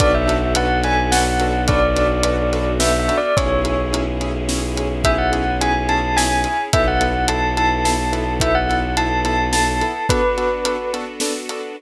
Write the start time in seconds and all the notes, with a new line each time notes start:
0.00 B1 B3 D4 F#4 A4 B4 D5, kick, closed hi-hat
0.14 E5
0.27 D4 F#4 A4 B4, closed hi-hat
0.55 D4 F#4 A4 B4 F#5, closed hi-hat
0.84 D4 F#4 A4 B4 G#5, closed hi-hat
1.12 D4 F#4 A4 B4 F#5, snare
1.40 D4 F#4 A4 B4, closed hi-hat
1.68 D4 F#4 A4 B4 D5, kick, closed hi-hat
1.96 D4 F#4 A4 B4, closed hi-hat
2.23 D4 F#4 A4 B4, closed hi-hat
2.53 D4 F#4 A4 B4, closed hi-hat
2.80 D4 F#4 A4 B4 E5, snare
2.99 E5
3.08 D4 F#4 A4 B4, closed hi-hat
3.18 D5
3.36 B1 C#4 E4 G#4 C#5, kick, closed hi-hat
3.64 C#4 E4 G#4, closed hi-hat
3.93 C#4 E4 G#4, closed hi-hat
4.21 C#4 E4 G#4, closed hi-hat
4.49 C#4 E4 G#4, snare
4.77 C#4 E4 G#4, closed hi-hat
5.04 C#4 E4 G#4 E5, kick, closed hi-hat
5.18 F#5
5.32 C#4 E4 G#4, closed hi-hat
5.61 C#4 E4 G#4 G#5, closed hi-hat
5.88 C#4 E4 G#4 A5, closed hi-hat
6.16 C#4 E4 G#4 G#5, snare
6.44 C#4 E4 G#4, closed hi-hat
6.73 B1 B3 E4 A4 E5, kick, closed hi-hat
6.88 F#5
7.01 B3 E4 A4, closed hi-hat
7.28 B3 E4 A4 A5, closed hi-hat
7.57 B3 E4 A4 A5, closed hi-hat
7.85 B3 E4 A4 A5, snare
8.13 B3 E4 A4, closed hi-hat
8.40 B3 E4 A4 E5, kick, closed hi-hat
8.55 F#5
8.69 B3 E4 A4, closed hi-hat
8.97 B3 E4 A4 A5, closed hi-hat
9.25 B3 E4 A4 A5, closed hi-hat
9.53 B3 E4 A4 A5, snare
9.81 B3 E4 A4, closed hi-hat
10.09 B3 D4 F#4 A4 B4, kick, closed hi-hat
10.37 B3 D4 F#4 A4, closed hi-hat
10.65 B3 D4 F#4 A4, closed hi-hat
10.93 B3 D4 F#4 A4, closed hi-hat
11.20 B3 D4 F#4 A4, snare
11.49 B3 D4 F#4 A4, closed hi-hat